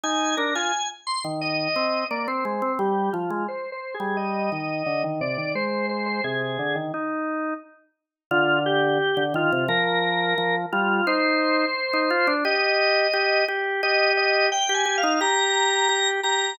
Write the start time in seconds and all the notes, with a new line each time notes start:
0.03 D#4 G#5
0.37 D4 A#4
0.55 F4 G#5
1.07 C6
1.24 D#3
1.41 D#5
1.76 C4
2.10 A#3 D5
2.28 C4 C5
2.45 G#3
2.62 C4
2.79 G3 G4
3.13 F3 F4
3.30 G#3
3.48 C5
3.72 C5
3.94 G#4
4.00 G3
4.17 D#5
4.52 D#3
4.86 D3
5.04 D#3
5.21 C3 D5
5.37 D#3
5.55 G#3 C5
5.89 C5
6.06 C5
6.24 C3 G#4
6.59 D3
6.75 D#3
6.94 D#4
8.31 D3 F4
8.66 G4
9.17 D3
9.34 D#3 F4
9.52 C3
9.68 F3 A#4
10.38 F3
10.72 G3 F4
11.07 D#4 C5
11.93 D#4
12.10 F4
12.27 D4
12.45 G4 D#5
13.13 G4
13.48 G4
13.83 G4 D#5
14.17 D#5
14.52 G5
14.69 G4
14.74 G#5
14.85 G4
14.98 F5
15.03 D#4
15.21 G4 A#5
15.89 G4
16.23 G4 A#5